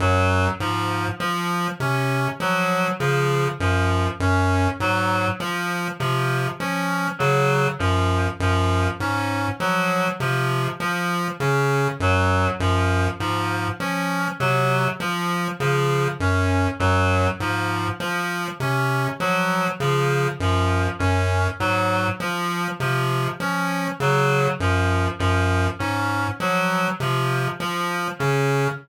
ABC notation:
X:1
M:6/8
L:1/8
Q:3/8=33
K:none
V:1 name="Lead 1 (square)" clef=bass
_G,, _A,, F, C, F, _D, | _G,, G,, _A,, F, C, F, | _D, _G,, G,, _A,, F, C, | F, _D, _G,, G,, _A,, F, |
C, F, _D, _G,, G,, _A,, | F, C, F, _D, _G,, G,, | _A,, F, C, F, _D, _G,, | _G,, _A,, F, C, F, _D, |]
V:2 name="Clarinet"
_G, F, F, _D G, F, | F, _D _G, F, F, D | _G, F, F, _D G, F, | F, _D _G, F, F, D |
_G, F, F, _D G, F, | F, _D _G, F, F, D | _G, F, F, _D G, F, | F, _D _G, F, F, D |]